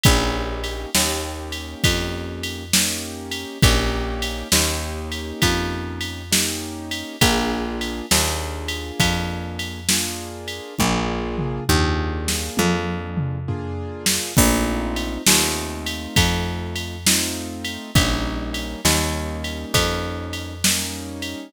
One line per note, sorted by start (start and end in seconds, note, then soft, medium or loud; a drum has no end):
0.04 0.86 A#1 loud
0.04 0.90 A#3 loud
0.04 0.90 C#4 loud
0.04 0.90 D#4 loud
0.04 0.90 G4 loud
0.04 kick loud
0.04 ride loud
0.64 ride medium
0.95 1.75 D#2 medium
0.95 2.64 A#3 medium
0.95 2.64 C#4 medium
0.95 2.64 D#4 medium
0.95 2.64 G4 medium
0.95 snare loud
1.52 ride medium
1.84 3.45 F2 medium
1.84 kick loud
1.84 ride loud
2.43 ride medium
2.74 3.58 A#3 medium
2.74 3.58 C#4 medium
2.74 3.58 D#4 medium
2.74 3.58 G4 medium
2.74 snare loud
3.32 ride medium
3.62 4.44 A#1 loud
3.62 4.48 A#3 loud
3.62 4.48 C#4 loud
3.62 4.48 D#4 medium
3.62 4.48 G4 loud
3.62 kick loud
3.62 ride loud
4.22 ride medium
4.52 5.33 D#2 medium
4.52 6.22 A#3 medium
4.52 6.22 C#4 medium
4.52 6.22 D#4 loud
4.52 6.22 G4 medium
4.52 snare loud
5.12 ride medium
5.42 7.03 F2 medium
5.42 kick medium
5.42 ride loud
6.01 ride medium
6.32 7.16 A#3 medium
6.32 7.16 C#4 medium
6.32 7.16 D#4 loud
6.32 7.16 G4 medium
6.32 snare loud
6.91 ride medium
7.21 8.02 A#1 loud
7.21 8.06 A#3 loud
7.21 8.06 D4 medium
7.21 8.06 F4 loud
7.21 8.06 G#4 loud
7.21 kick loud
7.21 ride loud
7.81 ride medium
8.11 8.92 D#2 medium
8.11 9.80 A#3 medium
8.11 9.80 D4 medium
8.11 9.80 F4 medium
8.11 9.80 G#4 medium
8.11 snare loud
8.68 ride medium
9.00 10.60 F2 medium
9.00 kick medium
9.00 ride loud
9.59 ride medium
9.89 10.74 A#3 medium
9.89 10.74 D4 medium
9.89 10.74 F4 medium
9.89 10.74 G#4 medium
9.89 snare loud
10.48 ride medium
10.79 11.60 A#1 loud
10.79 11.64 A#3 loud
10.79 11.64 D4 loud
10.79 11.64 F4 loud
10.79 11.64 G#4 loud
10.79 kick medium
10.79 high tom medium
11.38 mid tom medium
11.69 12.49 D#2 loud
11.69 13.38 A#3 medium
11.69 13.38 D4 medium
11.69 13.38 F4 medium
11.69 13.38 G#4 medium
11.69 floor tom medium
12.28 snare medium
12.57 14.19 F2 medium
12.57 high tom medium
13.17 mid tom medium
13.48 14.33 A#3 medium
13.48 14.33 D4 medium
13.48 14.33 F4 loud
13.48 14.33 G#4 medium
13.48 floor tom medium
14.06 snare loud
14.37 15.18 A#1 loud
14.37 15.22 A3 loud
14.37 15.22 C4 loud
14.37 15.22 D#4 loud
14.37 15.22 F4 loud
14.37 kick loud
14.37 crash loud
14.96 ride medium
15.26 16.07 D#2 medium
15.26 16.97 A3 medium
15.26 16.97 C4 medium
15.26 16.97 D#4 medium
15.26 16.97 F4 medium
15.26 snare loud
15.86 ride medium
16.16 17.78 F2 medium
16.16 kick loud
16.16 ride loud
16.76 ride medium
17.06 17.91 A3 medium
17.06 17.91 C4 medium
17.06 17.91 D#4 loud
17.06 17.91 F4 medium
17.06 snare loud
17.65 ride medium
17.95 18.76 A#1 medium
17.95 18.81 G3 medium
17.95 18.81 A#3 loud
17.95 18.81 C#4 loud
17.95 18.81 D#4 loud
17.95 kick loud
17.95 ride loud
18.54 ride medium
18.85 19.65 D#2 medium
18.85 20.55 G3 medium
18.85 20.55 A#3 medium
18.85 20.55 C#4 medium
18.85 20.55 D#4 medium
18.85 snare loud
19.44 ride medium
19.74 21.35 F2 loud
19.74 kick medium
19.74 ride loud
20.33 ride medium
20.64 21.49 G3 medium
20.64 21.49 A#3 medium
20.64 21.49 C#4 loud
20.64 21.49 D#4 medium
20.64 snare loud
21.22 ride medium